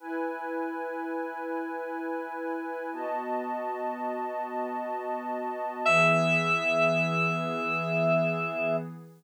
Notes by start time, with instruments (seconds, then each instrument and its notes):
0.00 pad 5 (bowed) E4 B4 G#5
2.93 pad 5 (bowed) B3 F#4 D#5 A5
5.85 pad 5 (bowed) E3 B3 G#4, electric piano 2 E5